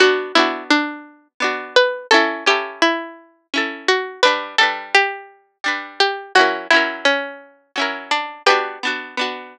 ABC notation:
X:1
M:3/4
L:1/8
Q:1/4=85
K:Bm
V:1 name="Pizzicato Strings"
F E D2 z B | A G E2 z F | B A G2 z G | F E C2 z D |
[GB]4 z2 |]
V:2 name="Pizzicato Strings"
[B,DF] [B,DF]3 [B,DF]2 | [CEA] [CEA]3 [CEA]2 | [G,DB] [G,DB]3 [G,DB]2 | [F,CE^A] [F,CEA]3 [F,CEA]2 |
[B,DF] [B,DF] [B,DF]4 |]